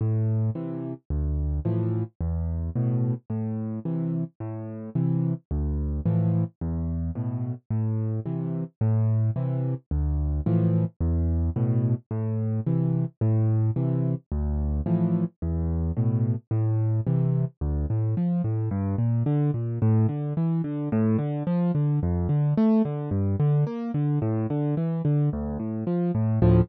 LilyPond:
\new Staff { \time 4/4 \key a \minor \tempo 4 = 109 a,4 <c e>4 d,4 <a, e f>4 | e,4 <a, b,>4 a,4 <c e>4 | a,4 <c e>4 d,4 <a, e f>4 | e,4 <a, b,>4 a,4 <c e>4 |
a,4 <c e>4 d,4 <a, e f>4 | e,4 <a, b,>4 a,4 <c e>4 | a,4 <c e>4 d,4 <a, e f>4 | e,4 <a, b,>4 a,4 <c e>4 |
\key d \minor d,8 a,8 f8 a,8 g,8 bes,8 d8 bes,8 | a,8 d8 e8 d8 a,8 d8 f8 d8 | f,8 d8 a8 d8 g,8 d8 bes8 d8 | a,8 d8 e8 d8 d,8 a,8 f8 a,8 |
<d, a, f>4 r2. | }